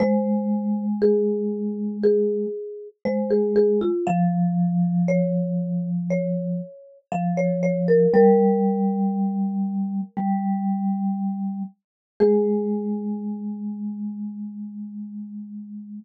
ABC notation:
X:1
M:4/4
L:1/16
Q:1/4=59
K:Ab
V:1 name="Marimba"
c4 A4 A4 c A A F | f4 d4 d4 f d d B | B14 z2 | A16 |]
V:2 name="Vibraphone" clef=bass
A,12 A,4 | F,12 F,4 | G,8 G,6 z2 | A,16 |]